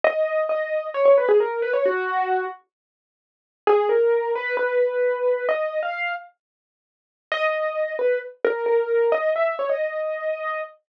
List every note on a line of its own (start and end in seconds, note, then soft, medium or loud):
0.04 0.44 D#5 medium
0.49 0.87 D#5 medium
0.94 1.05 C#5 medium
1.05 1.16 C#5 medium
1.18 1.28 B4 medium
1.29 1.39 G#4 medium
1.40 1.62 A#4 medium
1.62 1.73 B4 medium
1.73 1.84 C#5 medium
1.86 2.45 F#4 loud
3.67 3.89 G#4 loud
3.89 4.32 A#4 medium
4.35 4.56 B4 medium
4.57 5.46 B4 medium
5.49 5.80 D#5 medium
5.83 6.13 F5 medium
7.32 7.94 D#5 loud
7.99 8.19 B4 medium
8.45 8.66 A#4 medium
8.66 9.10 A#4 medium
9.12 9.31 D#5 loud
9.36 9.56 E5 medium
9.59 9.70 C#5 medium
9.69 10.61 D#5 medium